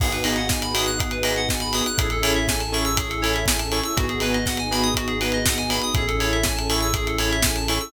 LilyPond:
<<
  \new Staff \with { instrumentName = "Lead 2 (sawtooth)" } { \time 4/4 \key gis \phrygian \tempo 4 = 121 <b dis' fis' gis'>8 <b dis' fis' gis'>4 <b dis' fis' gis'>4 <b dis' fis' gis'>4 <b dis' fis' gis'>8 | <cis' e' gis' a'>8 <cis' e' gis' a'>4 <cis' e' gis' a'>4 <cis' e' gis' a'>4 <cis' e' gis' a'>8 | <b dis' fis' gis'>8 <b dis' fis' gis'>4 <b dis' fis' gis'>4 <b dis' fis' gis'>4 <b dis' fis' gis'>8 | <cis' e' gis' a'>8 <cis' e' gis' a'>4 <cis' e' gis' a'>4 <cis' e' gis' a'>4 <cis' e' gis' a'>8 | }
  \new Staff \with { instrumentName = "Electric Piano 2" } { \time 4/4 \key gis \phrygian gis'16 b'16 dis''16 fis''16 gis''16 b''16 dis'''16 fis'''16 gis'16 b'16 dis''16 fis''16 gis''16 b''16 dis'''16 fis'''16 | gis'16 a'16 cis''16 e''16 gis''16 a''16 cis'''16 e'''16 gis'16 a'16 cis''16 e''16 gis''16 a''16 cis'''16 e'''16 | fis'16 gis'16 b'16 dis''16 fis''16 gis''16 b''16 dis'''16 fis'16 gis'16 b'16 dis''16 fis''16 gis''16 b''16 dis'''16 | gis'16 a'16 cis''16 e''16 gis''16 a''16 cis'''16 e'''16 gis'16 a'16 cis''16 e''16 gis''16 a''16 cis'''16 e'''16 | }
  \new Staff \with { instrumentName = "Synth Bass 1" } { \clef bass \time 4/4 \key gis \phrygian gis,,1 | a,,1 | gis,,1 | a,,1 | }
  \new Staff \with { instrumentName = "Pad 2 (warm)" } { \time 4/4 \key gis \phrygian <b dis' fis' gis'>1 | <cis' e' gis' a'>1 | <b dis' fis' gis'>1 | <cis' e' gis' a'>1 | }
  \new DrumStaff \with { instrumentName = "Drums" } \drummode { \time 4/4 <cymc bd>16 hh16 hho16 hh16 <bd sn>16 hh16 hho16 hh16 <hh bd>16 hh16 hho16 hh16 <bd sn>16 hh16 hho16 hh16 | <hh bd>16 hh16 hho16 hh16 <bd sn>16 hh16 hho16 hh16 <hh bd>16 hh16 hho16 hh16 <bd sn>16 hh16 hho16 hh16 | <hh bd>16 hh16 hho16 hh16 <bd sn>16 hh16 hho16 hh16 <hh bd>16 hh16 hho16 hh16 <bd sn>16 hh16 hho16 hh16 | <hh bd>16 hh16 hho16 hh16 <bd sn>16 hh16 hho16 hh16 <hh bd>16 hh16 hho16 hh16 <bd sn>16 hh16 hho16 hh16 | }
>>